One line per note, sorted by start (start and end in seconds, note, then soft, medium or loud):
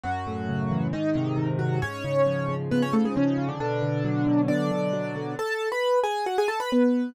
0.04 0.89 F#2 loud
0.04 0.86 F#3 medium
0.04 0.86 F#4 loud
0.27 0.90 A2 medium
0.49 0.91 C#3 medium
0.71 0.92 E3 medium
0.93 1.78 G#2 medium
0.93 1.48 D#3 loud
0.93 1.48 D#4 loud
1.15 1.59 C3 medium
1.38 1.80 D#3 medium
1.59 1.80 C3 medium
1.59 1.80 F#3 medium
1.59 1.80 F#4 medium
1.82 2.71 G#2 medium
1.82 2.55 C#4 loud
1.82 2.55 C#5 loud
2.04 2.48 C#3 medium
2.26 3.15 F3 medium
2.49 2.93 C#3 medium
2.71 3.56 G#2 medium
2.71 2.82 B3 medium
2.71 2.82 B4 loud
2.82 2.93 C#4 loud
2.82 2.93 C#5 loud
2.93 3.37 C#3 medium
2.93 3.04 A3 medium
2.93 3.04 A4 medium
3.05 3.16 G#3 medium
3.05 3.16 G#4 medium
3.16 3.48 C#3 loud
3.16 3.58 F3 medium
3.16 3.48 C#4 loud
3.38 3.59 C#3 medium
3.48 3.59 D3 medium
3.48 3.59 D4 loud
3.60 4.49 B2 medium
3.60 4.41 D3 loud
3.60 4.41 D4 loud
3.82 4.26 D3 medium
4.04 4.92 F#3 medium
4.27 4.71 D3 medium
4.48 5.34 B2 medium
4.48 5.34 D4 medium
4.48 5.34 D5 loud
4.71 5.15 D3 medium
4.93 5.35 F#3 medium
5.16 5.37 D3 medium
5.39 5.69 A4 medium
5.39 5.69 A5 loud
5.72 5.99 B4 medium
5.72 5.99 B5 loud
6.04 6.25 G#4 medium
6.04 6.25 G#5 loud
6.26 6.37 F#4 medium
6.26 6.37 F#5 loud
6.38 6.49 G#4 loud
6.38 6.49 G#5 loud
6.48 6.59 A4 medium
6.48 6.59 A5 loud
6.60 6.70 B4 medium
6.60 6.70 B5 loud
6.72 7.10 B3 medium
6.72 7.10 B4 medium